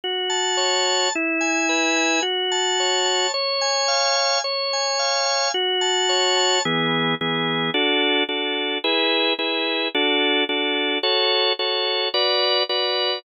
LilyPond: \new Staff { \time 4/4 \key fis \minor \tempo 4 = 109 fis'8 a''8 cis''8 a''8 e'8 gis''8 b'8 gis''8 | fis'8 a''8 cis''8 a''8 cis''8 gis''8 eis''8 gis''8 | cis''8 gis''8 eis''8 gis''8 fis'8 a''8 cis''8 a''8 | <e b gis'>4 <e b gis'>4 <d' fis' a'>4 <d' fis' a'>4 |
<e' gis' b'>4 <e' gis' b'>4 <d' fis' a'>4 <d' fis' a'>4 | <fis' a' cis''>4 <fis' a' cis''>4 <fis' b' d''>4 <fis' b' d''>4 | }